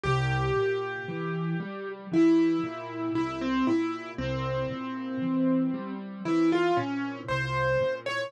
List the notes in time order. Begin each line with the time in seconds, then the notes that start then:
0.03 C2 G4
0.56 A#2
1.08 E3
1.60 G3
2.12 E3 E4
2.63 A#2
3.15 C2 E4
3.41 C4
3.67 A#2 E4
4.18 C2 C4
4.70 A#2
5.22 E3
5.74 G3
6.25 E3 E4
6.52 F4
6.77 A#2 C#4
7.28 C2 C5
7.81 A#2
8.06 C#5